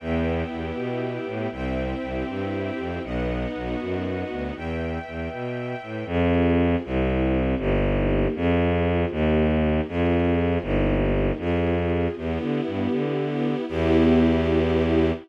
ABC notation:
X:1
M:6/8
L:1/8
Q:3/8=79
K:Em
V:1 name="String Ensemble 1"
B, E G E B, E | C E G E C E | B, ^D F D B, D | z6 |
[K:Fm] z6 | z6 | z6 | z6 |
[K:Em] B, E G E B, E | [B,EG]6 |]
V:2 name="Violin" clef=bass
E,,2 E,, B,,2 A,, | C,,2 C,, G,,2 =F,, | B,,,2 B,,, F,,2 D,, | E,,2 E,, B,,2 A,, |
[K:Fm] F,,3 C,,3 | G,,,3 F,,3 | E,,3 F,,3 | G,,,3 F,,3 |
[K:Em] E,, D, G,, D,3 | E,,6 |]
V:3 name="String Ensemble 1"
[Beg]6 | [ceg]6 | [B^df]6 | [Beg]6 |
[K:Fm] [CFA]3 [C=EG]3 | [B,EG]3 [CFA]3 | [B,EG]3 [CFA]3 | [B,EG]3 [CFA]3 |
[K:Em] [B,EG]6 | [B,EG]6 |]